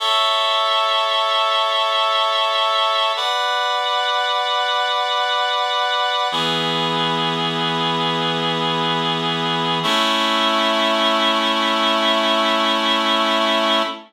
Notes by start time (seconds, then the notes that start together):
0.00 A4 C#5 E5
3.16 B4 D5 F#5
6.32 E3 B3 G#4
9.83 A3 C#4 E4